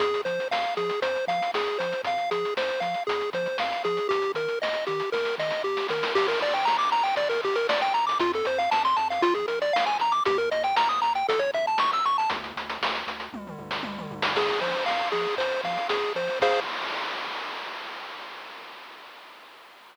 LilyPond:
<<
  \new Staff \with { instrumentName = "Lead 1 (square)" } { \time 4/4 \key f \minor \tempo 4 = 117 aes'8 c''8 f''8 aes'8 c''8 f''8 aes'8 c''8 | f''8 aes'8 c''8 f''8 aes'8 c''8 f''8 aes'8 | g'8 bes'8 ees''8 g'8 bes'8 ees''8 g'8 bes'8 | \key g \minor g'16 bes'16 d''16 g''16 bes''16 d'''16 bes''16 g''16 d''16 bes'16 g'16 bes'16 d''16 g''16 bes''16 d'''16 |
f'16 a'16 c''16 f''16 a''16 c'''16 a''16 f''16 f'16 aes'16 bes'16 d''16 f''16 aes''16 bes''16 d'''16 | g'16 bes'16 ees''16 g''16 bes''16 ees'''16 bes''16 g''16 a'16 cis''16 e''16 a''16 cis'''16 e'''16 cis'''16 a''16 | r1 | \key f \minor aes'8 c''8 f''8 aes'8 c''8 f''8 aes'8 c''8 |
<aes' c'' f''>4 r2. | }
  \new Staff \with { instrumentName = "Synth Bass 1" } { \clef bass \time 4/4 \key f \minor f,8 f8 f,8 f8 f,8 f8 f,8 f8 | f,8 f8 f,8 f8 f,8 f8 f,8 f8 | ees,8 ees8 ees,8 ees8 ees,8 ees8 ees,8 ees8 | \key g \minor g,,8 g,,8 g,,8 g,,8 g,,8 g,,8 g,,8 g,,8 |
f,8 f,8 f,8 f,8 bes,,8 bes,,8 bes,,8 bes,,8 | ees,8 ees,8 ees,8 ees,8 a,,8 a,,8 a,,8 a,,8 | d,8 d,8 d,8 d,8 d,8 d,8 d,8 d,8 | \key f \minor f,8 f8 f,8 f8 f,8 f8 f,8 f8 |
f,4 r2. | }
  \new DrumStaff \with { instrumentName = "Drums" } \drummode { \time 4/4 <hh bd>16 hh16 hh16 hh16 sn16 hh16 hh16 hh16 <hh bd>16 hh16 <hh bd>16 hh16 sn16 hh16 hh16 hh16 | <hh bd>16 hh16 hh16 hh16 sn16 hh16 hh16 hh16 <hh bd>16 hh16 <hh bd>16 hh16 sn16 hh16 hh16 hh16 | <hh bd>16 hh16 hh16 hh16 sn16 hh16 hh16 hh16 <bd sn>16 sn16 sn16 sn16 r16 sn16 sn16 sn16 | <cymc bd>16 hh16 hh16 hh16 sn16 hh16 hh16 hh16 <hh bd>16 hh16 <hh bd>16 hh16 sn16 hh16 hh16 hh16 |
<hh bd>16 hh16 hh16 hh16 sn16 hh16 hh16 hh16 <hh bd>16 <hh bd>16 hh16 hh16 sn16 hh16 hh16 hh16 | <hh bd>16 hh16 hh16 hh16 sn16 hh16 hh16 hh16 <hh bd>16 hh16 <hh bd>16 hh16 sn16 hh16 hh16 hh16 | <hh bd>16 hh16 hh16 hh16 sn16 hh16 hh16 hh16 <bd tommh>16 toml16 tomfh16 sn16 tommh16 toml16 tomfh16 sn16 | <cymc bd>16 hh16 hh16 hh16 sn16 hh16 hh16 hh16 <hh bd>16 hh16 <hh bd>16 hh16 sn16 hh16 hh16 hho16 |
<cymc bd>4 r4 r4 r4 | }
>>